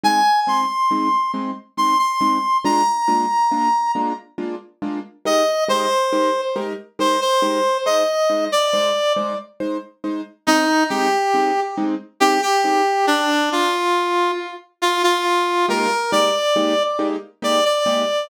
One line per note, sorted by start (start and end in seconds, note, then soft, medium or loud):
0.03 0.21 G#3 loud
0.03 0.21 C4 loud
0.03 0.21 D#4 medium
0.03 0.40 G#5 medium
0.47 0.64 G#3 medium
0.47 0.64 C4 medium
0.47 0.64 D#4 medium
0.47 1.31 C6 medium
0.91 1.08 G#3 medium
0.91 1.08 C4 medium
0.91 1.08 D#4 medium
1.34 1.51 G#3 medium
1.34 1.51 C4 medium
1.34 1.51 D#4 medium
1.77 1.95 G#3 medium
1.77 1.95 C4 medium
1.77 1.95 D#4 medium
1.77 1.98 C6 medium
1.98 2.58 C6 medium
2.21 2.38 G#3 medium
2.21 2.38 C4 medium
2.21 2.38 D#4 medium
2.64 2.82 G#3 loud
2.64 2.82 A#3 loud
2.64 2.82 D4 loud
2.64 2.82 F4 loud
2.64 3.91 A#5 medium
3.08 3.25 G#3 medium
3.08 3.25 A#3 medium
3.08 3.25 D4 medium
3.08 3.25 F4 medium
3.51 3.69 G#3 medium
3.51 3.69 A#3 medium
3.51 3.69 D4 medium
3.51 3.69 F4 medium
3.95 4.12 G#3 medium
3.95 4.12 A#3 medium
3.95 4.12 D4 medium
3.95 4.12 F4 medium
4.38 4.55 G#3 medium
4.38 4.55 A#3 medium
4.38 4.55 D4 medium
4.38 4.55 F4 medium
4.82 4.99 G#3 medium
4.82 4.99 A#3 medium
4.82 4.99 D4 medium
4.82 4.99 F4 medium
5.25 5.43 G#3 medium
5.25 5.43 D#4 loud
5.25 5.43 G4 medium
5.25 5.43 A#4 medium
5.25 5.64 D#5 medium
5.68 5.86 G#3 medium
5.68 5.86 D#4 medium
5.68 5.86 G4 medium
5.68 5.86 A#4 medium
5.68 6.41 C5 medium
6.12 6.30 G#3 medium
6.12 6.30 D#4 medium
6.12 6.30 G4 medium
6.12 6.30 A#4 medium
6.56 6.73 G#3 medium
6.56 6.73 D#4 medium
6.56 6.73 G4 medium
6.56 6.73 A#4 loud
6.99 7.16 G#3 medium
6.99 7.16 D#4 medium
6.99 7.16 G4 medium
6.99 7.16 A#4 medium
6.99 7.20 C5 medium
7.21 7.77 C5 medium
7.42 7.60 G#3 medium
7.42 7.60 D#4 medium
7.42 7.60 G4 medium
7.42 7.60 A#4 medium
7.86 8.03 G#3 loud
7.86 8.03 D#4 loud
7.86 8.03 C5 loud
7.86 8.45 D#5 medium
8.30 8.47 G#3 medium
8.30 8.47 D#4 medium
8.30 8.47 C5 medium
8.52 9.13 D5 medium
8.73 8.91 G#3 medium
8.73 8.91 D#4 medium
8.73 8.91 C5 medium
9.16 9.34 G#3 medium
9.16 9.34 D#4 medium
9.16 9.34 C5 medium
9.60 9.78 G#3 medium
9.60 9.78 D#4 medium
9.60 9.78 C5 medium
10.04 10.21 G#3 medium
10.04 10.21 D#4 medium
10.04 10.21 C5 medium
10.47 10.65 G#3 loud
10.47 10.65 C4 loud
10.47 10.84 D#4 medium
10.47 10.65 D#4 loud
10.90 11.08 G#3 loud
10.90 11.08 C4 loud
10.90 11.08 D#4 medium
10.90 11.60 G4 medium
11.34 11.51 G#3 medium
11.34 11.51 C4 loud
11.34 11.51 D#4 loud
11.77 11.95 G#3 loud
11.77 11.95 C4 loud
11.77 11.95 D#4 loud
12.20 12.38 G#3 medium
12.20 12.38 C4 loud
12.20 12.38 D#4 loud
12.20 12.41 G4 medium
12.42 13.06 G4 medium
12.64 12.82 G#3 medium
12.64 12.82 C4 loud
12.64 12.82 D#4 loud
13.07 13.49 D4 medium
13.52 14.31 F4 medium
14.82 15.02 F4 medium
15.03 15.66 F4 medium
15.68 15.86 G#3 loud
15.68 15.86 A#3 loud
15.68 15.86 D#4 loud
15.68 15.86 G4 loud
15.68 16.11 A#4 medium
16.12 16.30 G#3 medium
16.12 16.30 A#3 medium
16.12 16.30 D#4 loud
16.12 16.30 G4 loud
16.12 16.83 D5 medium
16.56 16.73 G#3 medium
16.56 16.73 A#3 loud
16.56 16.73 D#4 loud
16.56 16.73 G4 medium
16.99 17.16 G#3 medium
16.99 17.16 A#3 medium
16.99 17.16 D#4 loud
16.99 17.16 G4 loud
17.42 17.60 G#3 medium
17.42 17.60 A#3 loud
17.42 17.60 D#4 medium
17.42 17.60 G4 loud
17.42 17.64 D5 medium
17.65 18.27 D5 medium
17.86 18.03 G#3 loud
17.86 18.03 A#3 medium
17.86 18.03 D#4 loud
17.86 18.03 G4 loud